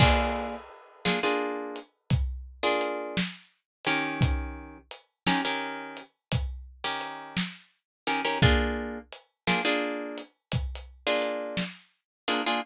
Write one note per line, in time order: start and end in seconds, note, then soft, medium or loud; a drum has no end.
0.00 0.56 A#3 loud
0.00 0.56 D4 loud
0.00 0.56 F4 loud
0.00 0.56 G#4 loud
0.00 kick medium
0.00 crash medium
1.05 1.19 A#3 medium
1.05 1.19 D4 medium
1.05 1.19 F4 loud
1.05 1.19 G#4 loud
1.05 snare medium
1.23 1.79 A#3 loud
1.23 1.79 D4 loud
1.23 1.79 F4 medium
1.23 1.79 G#4 loud
1.76 closed hi-hat medium
2.10 kick medium
2.10 closed hi-hat medium
2.63 3.19 A#3 loud
2.63 3.19 D4 loud
2.63 3.19 F4 loud
2.63 3.19 G#4 loud
2.81 closed hi-hat medium
3.17 snare medium
3.85 4.78 D#3 loud
3.85 4.78 C#4 loud
3.85 4.78 G4 loud
3.85 4.78 A#4 loud
3.85 closed hi-hat medium
4.21 kick medium
4.21 closed hi-hat medium
4.91 closed hi-hat medium
5.26 5.41 D#3 loud
5.26 5.41 C#4 loud
5.26 5.41 G4 medium
5.26 5.41 A#4 loud
5.26 snare medium
5.45 6.01 D#3 loud
5.45 6.01 C#4 loud
5.45 6.01 G4 medium
5.45 6.01 A#4 loud
5.97 closed hi-hat medium
6.32 kick medium
6.32 closed hi-hat loud
6.84 7.40 D#3 medium
6.84 7.40 C#4 loud
6.84 7.40 G4 loud
6.84 7.40 A#4 medium
7.01 closed hi-hat medium
7.37 snare medium
8.07 8.21 D#3 loud
8.07 8.21 C#4 loud
8.07 8.21 G4 medium
8.07 8.21 A#4 medium
8.07 closed hi-hat medium
8.25 8.39 D#3 loud
8.25 8.39 C#4 loud
8.25 8.39 G4 loud
8.25 8.39 A#4 loud
8.42 8.99 A#3 loud
8.42 8.99 D4 loud
8.42 8.99 F4 loud
8.42 8.99 G#4 loud
8.42 kick medium
8.42 closed hi-hat medium
9.12 closed hi-hat medium
9.47 9.61 A#3 loud
9.47 9.61 D4 loud
9.47 9.61 F4 medium
9.47 9.61 G#4 loud
9.47 snare medium
9.65 10.21 A#3 loud
9.65 10.21 D4 loud
9.65 10.21 F4 medium
9.65 10.21 G#4 loud
10.18 closed hi-hat medium
10.52 kick medium
10.52 closed hi-hat medium
10.75 closed hi-hat medium
11.07 11.63 A#3 loud
11.07 11.63 D4 medium
11.07 11.63 F4 loud
11.07 11.63 G#4 loud
11.22 closed hi-hat medium
11.57 snare medium
12.28 12.42 A#3 loud
12.28 12.42 D4 loud
12.28 12.42 F4 medium
12.28 12.42 G#4 loud
12.28 open hi-hat medium
12.46 12.60 A#3 loud
12.46 12.60 D4 medium
12.46 12.60 F4 loud
12.46 12.60 G#4 loud